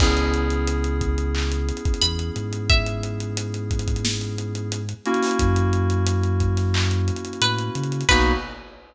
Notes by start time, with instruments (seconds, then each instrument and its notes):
0.00 synth bass 2 C#2, electric piano 2 B3 C#4 E4 G#4, kick, crash
0.17 closed hi-hat
0.34 closed hi-hat
0.50 closed hi-hat
0.67 closed hi-hat
0.84 closed hi-hat
1.01 kick, closed hi-hat
1.18 closed hi-hat
1.35 clap
1.52 closed hi-hat
1.69 closed hi-hat
1.77 closed hi-hat
1.85 kick, closed hi-hat
1.94 closed hi-hat
2.02 synth bass 2 E2, pizzicato strings B5, closed hi-hat
2.19 closed hi-hat
2.36 synth bass 2 G#2, closed hi-hat
2.53 closed hi-hat
2.70 pizzicato strings E5, kick, closed hi-hat
2.87 closed hi-hat
3.03 closed hi-hat
3.20 closed hi-hat
3.37 closed hi-hat
3.54 closed hi-hat
3.71 kick, closed hi-hat
3.79 closed hi-hat
3.88 kick, closed hi-hat
3.96 closed hi-hat
4.05 snare
4.21 closed hi-hat
4.38 closed hi-hat
4.55 closed hi-hat
4.72 closed hi-hat
4.89 closed hi-hat
5.05 electric piano 2 A#3 C#4 E4 F#4, closed hi-hat
5.14 closed hi-hat
5.22 snare, open hi-hat
5.31 closed hi-hat
5.39 synth bass 2 F#2, kick, closed hi-hat
5.56 closed hi-hat
5.73 closed hi-hat
5.90 closed hi-hat
6.07 closed hi-hat
6.23 closed hi-hat
6.40 kick, closed hi-hat
6.57 snare, closed hi-hat
6.74 clap
6.91 closed hi-hat
7.08 closed hi-hat
7.16 closed hi-hat
7.25 closed hi-hat
7.33 closed hi-hat
7.41 synth bass 2 A2, pizzicato strings B4, closed hi-hat
7.59 closed hi-hat
7.75 synth bass 2 C#3, closed hi-hat
7.84 closed hi-hat
7.92 closed hi-hat
8.01 closed hi-hat
8.09 synth bass 2 B1, electric piano 2 A#3 B3 D#4 F#4, pizzicato strings B4, kick, crash